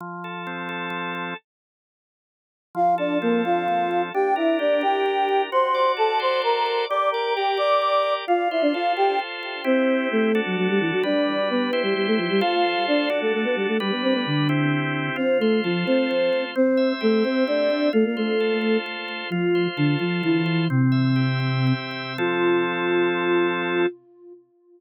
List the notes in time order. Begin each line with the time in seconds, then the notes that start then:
0.00 F3
0.24 A4
0.47 C4
0.69 A4
0.90 F3
1.15 A4
2.75 F3 F4 F5
2.98 D4 A4 D5
3.22 A#3 C4 A#4
3.45 F4 A4 F5
3.68 F3
3.91 A4
4.14 D4 G4 G5
4.36 E4 A#4 E5
4.59 D4 G4 D5
4.81 G4 A#4 G5
5.06 D4
5.29 A#4
5.52 F#4 C5 C6
5.75 D5
5.97 A4 A5
6.20 C5 C6
6.42 F#4 A#4 A#5
6.66 D5
6.89 G4 D5 D6
7.12 A#4 D5 A#5
7.36 G4 A#4 G5
7.57 D5 D6
7.82 G4
8.03 D5
8.27 F4 F5
8.51 E4 C5 E5
8.62 D4 D5
8.74 F4 A4 F5
8.97 G4 C5 G5
9.19 F4
9.43 C5
9.64 C4 E4 G4 C5
10.11 A3 A4
10.35 D4 F#4 A4
10.46 F#3 F#4
10.57 F#3 F#4
10.69 G3 G4
10.81 E3 E4
10.92 F#3 F#4
11.03 G3 D4 B4 D5
11.50 B3 B4
11.73 E4 G4 C5
11.83 G3 G4
11.96 G3 G4
12.07 A3 A4
12.18 F3 F4
12.30 G3 G4
12.41 F4 A4 C5 F5
12.87 D4 D5
13.10 D4 F#4 A4
13.22 A3 A4
13.34 A3 A4
13.44 B3 B4
13.56 G3 G4
13.68 A3 A4
13.80 G3 D4 G4 B4
13.91 B3 B4
14.03 C4 C5
14.14 B3 B4
14.26 D3 D4
14.49 C4 E4 G4
15.16 C4 F4 C5
15.40 A3 A4 C5
15.64 F3 F4 A4
15.86 C4 C5
16.11 F4
16.33 C5
16.56 C4 C5
16.77 E5
17.01 A3 G4 A4
17.24 C4 C5 E5
17.47 C4 D4 D5
17.70 E5
17.93 A3 F4 A4
18.05 A#3 A#4
18.17 A3 A4 C5
18.40 A4
18.61 C5
18.86 F4
19.08 C5
19.30 F3 F4
19.55 C5
19.77 D3 D4 A4
19.99 F3 F4 C5
20.23 E3 E4 F4
20.46 C5
20.70 C3 C4
20.92 E5
21.16 G4
21.40 E5
21.67 C4
21.91 E5
22.18 F3 C4 F4 A4